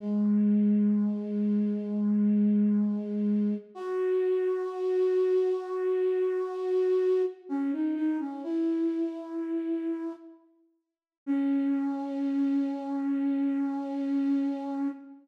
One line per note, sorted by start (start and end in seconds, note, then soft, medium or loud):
0.00 3.54 G#3 medium
3.75 7.22 F#4 medium
7.49 7.71 C#4 medium
7.73 7.95 D#4 medium
7.95 8.18 D#4 medium
8.20 8.42 C#4 medium
8.44 10.12 E4 medium
11.26 14.88 C#4 loud